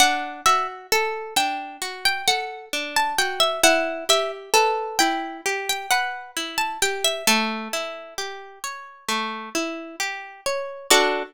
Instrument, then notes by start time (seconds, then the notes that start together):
orchestral harp
0.00 D4 F#5
0.46 F#4 E5
0.92 A4
1.36 D4 G5
1.82 F#4
2.05 G5
2.28 A4 F#5
2.73 D4
2.96 A5
3.18 F#4 G5
3.40 E5
3.63 E4 F#5
4.09 G4 E5
4.54 A4 B4
4.99 E4 G5
5.46 G4
5.69 G5
5.91 B4 F#5
6.37 E4
6.58 A5
6.82 G4 G5
7.04 E5
7.27 A3 A4
7.73 E4
8.18 G4
8.64 C#5
9.09 A3
9.55 E4
10.00 G4
10.46 C#5
10.91 D4 F#4 A4 D5